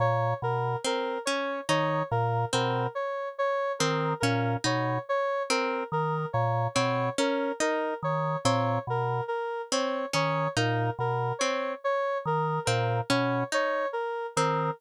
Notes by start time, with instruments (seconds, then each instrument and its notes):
0.00 drawbar organ A#2, lead 1 (square) C#5
0.42 drawbar organ B2, lead 1 (square) A#4
0.85 orchestral harp C4, lead 1 (square) A#4
1.25 orchestral harp C#4, lead 1 (square) C#5
1.69 drawbar organ D#3, orchestral harp D#4, lead 1 (square) C#5
2.11 drawbar organ A#2, lead 1 (square) A#4
2.53 drawbar organ B2, orchestral harp C4, lead 1 (square) A#4
2.95 lead 1 (square) C#5
3.38 lead 1 (square) C#5
3.79 drawbar organ D#3, orchestral harp C4, lead 1 (square) A#4
4.20 drawbar organ A#2, orchestral harp C#4, lead 1 (square) A#4
4.64 drawbar organ B2, orchestral harp D#4, lead 1 (square) C#5
5.09 lead 1 (square) C#5
5.50 orchestral harp C4, lead 1 (square) A#4
5.92 drawbar organ D#3, lead 1 (square) A#4
6.33 drawbar organ A#2, lead 1 (square) C#5
6.75 drawbar organ B2, orchestral harp C4, lead 1 (square) C#5
7.18 orchestral harp C#4, lead 1 (square) A#4
7.60 orchestral harp D#4, lead 1 (square) A#4
8.03 drawbar organ D#3, lead 1 (square) C#5
8.45 drawbar organ A#2, orchestral harp C4, lead 1 (square) C#5
8.87 drawbar organ B2, lead 1 (square) A#4
9.28 lead 1 (square) A#4
9.72 orchestral harp C4, lead 1 (square) C#5
10.13 drawbar organ D#3, orchestral harp C#4, lead 1 (square) C#5
10.57 drawbar organ A#2, orchestral harp D#4, lead 1 (square) A#4
10.99 drawbar organ B2, lead 1 (square) A#4
11.39 orchestral harp C4, lead 1 (square) C#5
11.84 lead 1 (square) C#5
12.26 drawbar organ D#3, lead 1 (square) A#4
12.65 drawbar organ A#2, orchestral harp C4, lead 1 (square) A#4
13.10 drawbar organ B2, orchestral harp C#4, lead 1 (square) C#5
13.52 orchestral harp D#4, lead 1 (square) C#5
13.93 lead 1 (square) A#4
14.36 drawbar organ D#3, orchestral harp C4, lead 1 (square) A#4